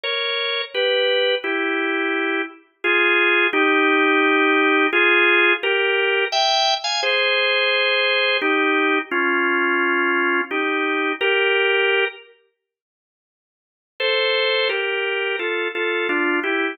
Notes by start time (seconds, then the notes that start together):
0.03 A#4 C#5
0.74 G4 B4
1.44 E4 G4
2.84 F4 G#4
3.53 D#4 G4
4.93 F4 G#4
5.63 G4 A#4
6.32 E5 G5
6.84 F5 G#5
7.03 G#4 C5
8.42 D#4 G4
9.11 C#4 F4
10.51 D#4 G4
11.21 G4 A#4
14.00 A4 C5
14.69 G4 A#4
15.39 F4 A4
15.75 F4 A4
16.09 D4 F4
16.43 E4 G4